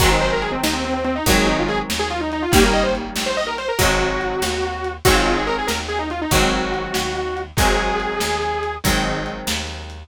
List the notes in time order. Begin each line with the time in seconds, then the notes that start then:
0.00 G#1 D#3 F#3 G#3 C4 F#4, kick, closed hi-hat
0.11 D#4
0.21 C5, closed hi-hat
0.33 A#4
0.42 G#4, closed hi-hat
0.52 C4
0.63 D#2 D#4, snare
0.73 C4
0.84 C4, closed hi-hat
0.94 C4
1.04 C4, closed hi-hat
1.15 D#4
1.26 G#1 D#3 F#3 G#3 F#4, kick, closed hi-hat
1.30 C4
1.38 G#4
1.47 D#4, closed hi-hat
1.59 F4
1.69 G#4, closed hi-hat
1.90 D#2, snare
1.99 G#4
2.10 F4, closed hi-hat
2.20 D#4
2.32 D#4, closed hi-hat
2.42 F4
2.52 G#1 D#3 G3 A#3 C#4 G4, kick, closed hi-hat
2.63 A#4
2.73 D#5, closed hi-hat
2.83 C5
2.95 closed hi-hat
3.16 A#1, snare
3.26 C5
3.37 D#5, closed hi-hat
3.47 A#4
3.58 C5, closed hi-hat
3.68 A#4
3.79 G#1 D#3 F#3 G#3 C4 F#4, kick, closed hi-hat
4.00 closed hi-hat
4.21 closed hi-hat
4.42 D#2, snare
4.63 closed hi-hat
4.84 closed hi-hat
5.05 G#1 D#3 F#3 G#3 C4 F#4, kick, closed hi-hat
5.15 F4
5.26 F4, closed hi-hat
5.36 G#4
5.46 A#4, closed hi-hat
5.58 G#4
5.67 D#2 A#4, snare
5.88 G#4, closed hi-hat
5.99 D#4
6.10 F4, closed hi-hat
6.22 D#4
6.31 G#1 D#3 F#3 G#3 C4 F#4, kick, closed hi-hat
6.52 closed hi-hat
6.74 closed hi-hat
6.94 D#2, snare
7.16 closed hi-hat
7.37 closed hi-hat
7.57 G#1 D#3 F#3 G#3 C4 G#4, kick, closed hi-hat
7.79 closed hi-hat
8.00 closed hi-hat
8.20 D#2, snare
8.42 closed hi-hat
8.63 closed hi-hat
8.84 G#1 D#3 F#3 G#3 C4, kick, closed hi-hat
9.05 closed hi-hat
9.26 closed hi-hat
9.47 D#2, snare
9.68 closed hi-hat
9.90 closed hi-hat